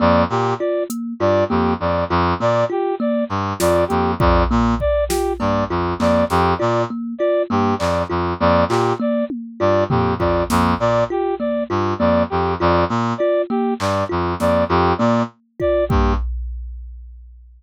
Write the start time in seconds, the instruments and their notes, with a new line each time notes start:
0.00 brass section F2 D5, kalimba A#3
0.30 brass section A#2 G4
0.59 kalimba F4, brass section D5
0.90 kalimba A#3, closed hi-hat
1.20 brass section G2 D5, kalimba F4
1.49 brass section F2 G4, kalimba A#3
1.80 brass section F2 D5, high tom
2.10 brass section F2, kalimba F4
2.40 brass section A#2 D5, kalimba A#3
2.70 kalimba F4, brass section G4
3.00 kalimba A#3, brass section D5
3.29 brass section G2, cowbell
3.60 brass section F2 D5, kalimba F4, snare
3.88 brass section F2 G4, kalimba A#3, closed hi-hat
4.19 brass section F2 D5, kalimba F4, kick
4.51 brass section A#2, kalimba A#3
4.80 brass section D5, kick
5.09 kalimba F4, brass section G4, snare
5.40 brass section G2 D5, kalimba A#3, cowbell
5.70 brass section F2, kalimba F4
5.99 brass section F2 D5, kalimba A#3, clap
6.30 brass section F2 G4, snare
6.58 brass section A#2 D5, kalimba F4
6.90 kalimba A#3
7.19 kalimba F4, brass section D5
7.50 brass section G2 G4, kalimba A#3
7.79 brass section F2 D5, clap
8.10 brass section F2, kalimba F4
8.40 brass section F2 D5, kalimba A#3
8.69 brass section A#2 G4, kalimba F4, clap
9.00 kalimba A#3, brass section D5
9.30 high tom
9.60 brass section G2 D5, kalimba F4
9.90 brass section F2 G4, kalimba A#3, floor tom
10.19 brass section F2 D5, kalimba F4, kick
10.50 brass section F2, kalimba A#3, snare
10.80 brass section A#2 D5
11.10 kalimba F4, brass section G4
11.39 kalimba A#3, brass section D5
11.70 brass section G2, kalimba F4
11.99 brass section F2 D5, kalimba A#3
12.30 brass section F2 G4
12.60 brass section F2 D5, kalimba F4
12.89 brass section A#2, kalimba A#3
13.18 kalimba F4, brass section D5
13.50 kalimba A#3, brass section G4
13.79 brass section G2 D5, clap
14.09 brass section F2, kalimba F4
14.40 brass section F2 D5, kalimba A#3, snare
14.69 brass section F2 G4, kalimba F4
14.98 brass section A#2 D5, kalimba A#3, high tom
15.60 kalimba F4, brass section D5, kick
15.89 brass section G2 G4, kalimba A#3, kick